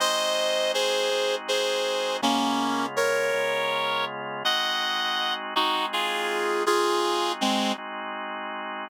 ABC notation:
X:1
M:6/8
L:1/8
Q:3/8=54
K:Ablyd
V:1 name="Clarinet"
[ce]2 [Ac]2 [Ac]2 | [B,_D]2 [B_d]3 z | [e_g]3 [E_G] [FA]2 | [FA]2 [A,C] z3 |]
V:2 name="Drawbar Organ"
[A,CE_G]3 [A,CEG]3 | [_D,A,_CF]3 [D,A,CF]3 | [A,CE_G]3 [A,CEG]3 | [A,CE_G]3 [A,CEG]3 |]